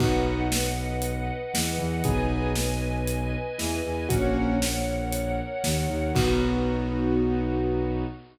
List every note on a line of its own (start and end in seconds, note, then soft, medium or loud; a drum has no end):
0.00 1.31 B1 loud
0.00 0.45 B3 medium
0.00 0.45 D#4 medium
0.00 0.45 F#4 medium
0.00 2.03 B4 medium
0.00 2.03 D#5 medium
0.00 2.03 F#5 medium
0.00 kick loud
0.00 crash medium
0.52 snare loud
1.02 closed hi-hat loud
1.54 1.76 E2 medium
1.54 1.76 E3 medium
1.54 snare loud
1.78 2.01 E2 loud
1.78 2.00 E3 medium
2.04 3.36 B1 loud
2.04 2.51 B3 medium
2.04 2.51 D#4 medium
2.04 2.51 G#4 loud
2.04 4.08 B4 medium
2.04 4.08 D#5 loud
2.04 4.08 G#5 medium
2.04 kick loud
2.04 closed hi-hat medium
2.55 snare medium
3.07 closed hi-hat medium
3.58 3.81 E2 loud
3.58 3.80 E3 medium
3.58 snare medium
3.85 4.06 E2 loud
3.85 4.08 E3 loud
4.09 5.41 A#1 loud
4.09 4.55 A#3 medium
4.09 4.55 C#4 medium
4.09 4.55 F#4 loud
4.09 6.13 A#4 medium
4.09 6.13 C#5 medium
4.09 6.13 F#5 medium
4.09 kick loud
4.09 closed hi-hat loud
4.62 snare loud
5.13 closed hi-hat loud
5.64 5.86 D#2 loud
5.64 5.86 D#3 medium
5.64 snare loud
5.89 6.11 D#2 loud
5.89 6.12 D#3 medium
6.15 8.04 B1 loud
6.15 8.03 B3 medium
6.15 8.04 B3 medium
6.15 8.03 D#4 medium
6.15 8.04 D#4 loud
6.15 8.03 F#4 loud
6.15 8.04 F#4 loud
6.15 kick loud
6.15 crash loud